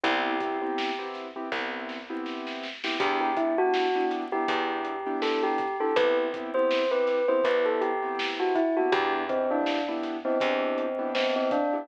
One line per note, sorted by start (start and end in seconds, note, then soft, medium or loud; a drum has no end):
0.04 1.42 C2 loud
0.04 0.34 B3 loud
0.04 0.34 C4 loud
0.04 0.34 E4 loud
0.04 1.08 G4 medium
0.04 0.34 G4 loud
0.04 kick loud
0.04 closed hi-hat loud
0.40 0.57 B3 medium
0.40 0.57 C4 medium
0.40 0.57 E4 medium
0.40 0.57 G4 medium
0.40 kick medium
0.40 snare soft
0.40 closed hi-hat medium
0.62 0.90 B3 medium
0.62 0.90 C4 medium
0.62 0.90 E4 medium
0.62 0.90 G4 medium
0.78 snare loud
0.99 1.27 B3 medium
0.99 1.27 C4 medium
0.99 1.27 E4 medium
0.99 1.27 G4 medium
1.14 snare medium
1.14 closed hi-hat medium
1.36 1.49 B3 medium
1.36 1.49 C4 medium
1.36 1.49 E4 medium
1.36 1.49 G4 medium
1.52 2.90 C2 medium
1.52 1.98 B3 medium
1.52 1.98 C4 medium
1.52 1.98 E4 medium
1.52 1.98 G4 medium
1.52 kick medium
1.52 snare medium
1.89 snare medium
2.10 2.67 B3 medium
2.10 2.67 C4 medium
2.10 2.67 E4 loud
2.10 2.67 G4 medium
2.26 snare medium
2.47 snare medium
2.63 snare medium
2.84 2.97 B3 medium
2.84 2.97 C4 medium
2.84 2.97 E4 medium
2.84 2.97 G4 loud
2.84 snare loud
3.00 4.38 E2 medium
3.00 3.31 B3 loud
3.00 3.31 D4 loud
3.00 3.31 E4 loud
3.00 3.20 G4 medium
3.00 3.31 G4 loud
3.00 kick loud
3.00 closed hi-hat loud
3.21 3.36 G4 medium
3.37 3.54 B3 medium
3.37 3.54 D4 medium
3.37 3.57 E4 medium
3.37 3.54 E4 medium
3.37 3.54 G4 medium
3.37 kick medium
3.37 closed hi-hat medium
3.58 3.87 B3 medium
3.58 3.87 D4 medium
3.58 3.87 E4 medium
3.58 4.05 F#4 medium
3.58 3.87 G4 medium
3.74 snare loud
3.95 4.24 B3 medium
3.95 4.24 D4 medium
3.95 4.24 E4 medium
3.95 4.24 G4 medium
4.11 snare medium
4.11 closed hi-hat medium
4.32 4.45 B3 medium
4.32 4.45 D4 medium
4.32 4.45 E4 medium
4.32 4.45 G4 medium
4.32 5.17 G4 medium
4.48 5.86 E2 loud
4.48 4.94 B3 medium
4.48 4.94 D4 medium
4.48 4.94 E4 medium
4.48 4.94 G4 medium
4.48 kick loud
4.48 closed hi-hat loud
4.85 closed hi-hat medium
5.06 5.64 B3 medium
5.06 5.64 D4 medium
5.06 5.64 E4 medium
5.06 5.64 G4 loud
5.22 5.42 A4 medium
5.22 snare loud
5.43 5.76 G4 medium
5.58 kick medium
5.58 snare soft
5.58 closed hi-hat medium
5.80 5.93 B3 loud
5.80 5.93 D4 medium
5.80 5.93 E4 loud
5.80 5.93 G4 medium
5.80 5.95 A4 medium
5.96 7.34 C2 loud
5.96 6.27 B3 medium
5.96 6.27 C4 medium
5.96 6.27 E4 loud
5.96 6.27 G4 loud
5.96 6.16 B4 medium
5.96 kick loud
5.96 closed hi-hat loud
6.33 6.50 B3 medium
6.33 6.50 C4 medium
6.33 6.50 E4 loud
6.33 6.50 G4 loud
6.33 kick medium
6.33 closed hi-hat medium
6.54 6.83 B3 loud
6.54 6.83 C4 medium
6.54 6.83 E4 loud
6.54 6.83 G4 medium
6.54 6.89 C5 medium
6.71 snare loud
6.91 7.20 B3 medium
6.91 7.20 C4 medium
6.91 7.20 E4 medium
6.91 7.20 G4 medium
6.91 7.26 B4 medium
7.07 snare medium
7.07 closed hi-hat medium
7.28 7.41 B3 medium
7.28 7.41 C4 medium
7.28 7.41 E4 medium
7.28 7.41 G4 medium
7.28 7.44 C5 medium
7.44 8.83 C2 medium
7.44 7.90 B3 medium
7.44 7.90 C4 medium
7.44 7.90 E4 medium
7.44 7.90 G4 medium
7.44 7.65 B4 medium
7.44 kick medium
7.44 closed hi-hat loud
7.66 7.81 A4 medium
7.81 8.30 G4 medium
7.81 closed hi-hat medium
8.02 8.60 B3 medium
8.02 8.60 C4 loud
8.02 8.60 E4 medium
8.02 8.60 G4 medium
8.19 snare loud
8.40 8.55 F#4 medium
8.55 8.75 E4 medium
8.55 kick medium
8.55 closed hi-hat medium
8.77 8.90 B3 medium
8.77 8.90 C4 medium
8.77 8.90 E4 medium
8.77 8.92 F#4 medium
8.77 8.90 G4 medium
8.92 10.30 E2 loud
8.92 9.23 B3 loud
8.92 9.23 D4 loud
8.92 9.23 E4 loud
8.92 9.23 G4 loud
8.92 9.13 G4 medium
8.92 kick loud
8.92 closed hi-hat loud
9.29 9.46 B3 medium
9.29 9.50 C4 medium
9.29 9.46 D4 medium
9.29 9.46 E4 medium
9.29 9.46 G4 medium
9.29 kick medium
9.29 closed hi-hat medium
9.51 9.80 B3 medium
9.51 9.83 D4 medium
9.51 9.80 D4 medium
9.51 9.80 E4 medium
9.51 9.80 G4 medium
9.66 snare loud
9.88 10.17 B3 loud
9.88 10.17 D4 medium
9.88 10.17 E4 medium
9.88 10.17 G4 medium
10.03 snare medium
10.03 closed hi-hat medium
10.25 10.38 B3 medium
10.25 11.09 C4 medium
10.25 10.38 D4 medium
10.25 10.38 E4 medium
10.25 10.38 G4 medium
10.40 11.79 E2 medium
10.40 10.86 B3 medium
10.40 10.86 D4 medium
10.40 10.86 E4 medium
10.40 10.86 G4 loud
10.40 kick loud
10.40 closed hi-hat loud
10.78 closed hi-hat medium
10.99 11.56 B3 medium
10.99 11.56 D4 medium
10.99 11.56 E4 medium
10.99 11.56 G4 medium
11.15 11.35 C4 medium
11.15 snare loud
11.36 11.51 C4 medium
11.51 11.88 D4 medium
11.51 kick loud
11.51 closed hi-hat medium
11.73 11.86 B3 medium
11.73 11.86 D4 medium
11.73 11.86 E4 medium
11.73 11.86 G4 medium